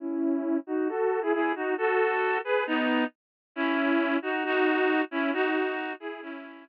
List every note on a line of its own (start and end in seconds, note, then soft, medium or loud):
0.00 0.57 C#4 medium
0.00 0.57 E4 medium
0.67 0.88 D#4 medium
0.67 0.88 F#4 medium
0.89 1.20 F#4 medium
0.89 1.20 A4 medium
1.22 1.33 E4 medium
1.22 1.33 G#4 medium
1.33 1.52 E4 medium
1.33 1.52 G#4 medium
1.55 1.74 D#4 medium
1.55 1.74 F#4 medium
1.78 2.38 F#4 medium
1.78 2.38 A4 medium
2.44 2.64 G#4 medium
2.44 2.64 B4 medium
2.67 3.04 B3 medium
2.67 3.04 D#4 medium
3.56 4.17 C#4 medium
3.56 4.17 E4 medium
4.22 4.44 D#4 medium
4.22 4.44 F#4 medium
4.45 5.02 D#4 medium
4.45 5.02 F#4 medium
5.11 5.31 C#4 medium
5.11 5.31 E4 medium
5.33 5.93 D#4 medium
5.33 5.93 F#4 medium
6.00 6.21 E4 medium
6.00 6.21 G#4 medium
6.22 6.65 C#4 medium
6.22 6.65 E4 medium